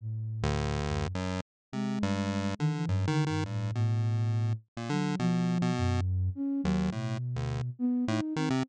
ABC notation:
X:1
M:3/4
L:1/16
Q:1/4=104
K:none
V:1 name="Flute"
A,,6 _G,,2 z4 | _A,6 _E, =E, (3G,,2 D,2 G,,2 | A,,2 A,,6 z2 _G,2 | F,4 _G,,4 _D2 _G,2 |
B,,6 B,2 _E2 C2 |]
V:2 name="Lead 1 (square)" clef=bass
z3 D,,5 _G,,2 z2 | C,2 G,,4 D,2 (3_G,,2 _E,2 E,2 | G,,2 B,,6 z _B,, D,2 | B,,3 B,,3 z4 _E,,2 |
A,,2 z D,,2 z3 A,, z _E, C, |]